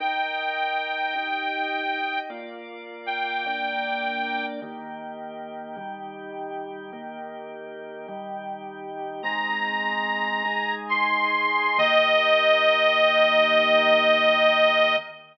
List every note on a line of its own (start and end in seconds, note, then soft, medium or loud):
0.00 1.14 D#4 medium
0.00 1.14 A#4 medium
0.00 2.20 G5 medium
0.00 1.14 G5 medium
1.15 2.29 D#4 medium
1.15 2.29 G4 medium
1.15 2.29 G5 medium
2.30 3.44 A#3 medium
2.30 3.44 F4 medium
2.30 3.44 D5 medium
3.06 4.46 G5 medium
3.46 4.60 A#3 medium
3.46 4.60 D4 medium
3.46 4.60 D5 medium
4.62 5.76 D#3 medium
4.62 5.76 A#3 medium
4.62 5.76 G4 medium
5.76 6.91 D#3 medium
5.76 6.91 G3 medium
5.76 6.91 G4 medium
6.92 8.07 D#3 medium
6.92 8.07 A#3 medium
6.92 8.07 G4 medium
8.08 9.22 D#3 medium
8.08 9.22 G3 medium
8.08 9.22 G4 medium
9.23 10.43 G#3 medium
9.23 10.43 C4 medium
9.23 10.43 D#4 medium
9.23 10.75 A#5 medium
10.45 11.78 G#3 medium
10.45 11.78 D#4 medium
10.45 11.78 G#4 medium
10.89 11.79 C6 medium
11.78 14.96 D#3 loud
11.78 14.96 A#3 medium
11.78 14.96 G4 loud
11.78 14.96 D#5 loud